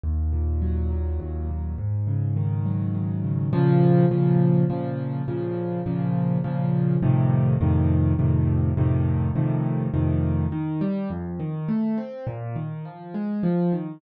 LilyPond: \new Staff { \time 3/4 \key des \major \tempo 4 = 103 ees,8 bes,8 ges8 bes,8 ees,8 bes,8 | aes,8 des8 ees8 ges8 ees8 des8 | \key bes \minor <bes, des f>4 <bes, des f>4 <bes, des f>4 | <bes, des f>4 <bes, des f>4 <bes, des f>4 |
<f, a, c ees>4 <f, a, c ees>4 <f, a, c ees>4 | <f, a, c ees>4 <f, a, c ees>4 <f, a, c ees>4 | \key ees \major ees8 g8 f,8 ees8 a8 c'8 | bes,8 ees8 f8 aes8 f8 ees8 | }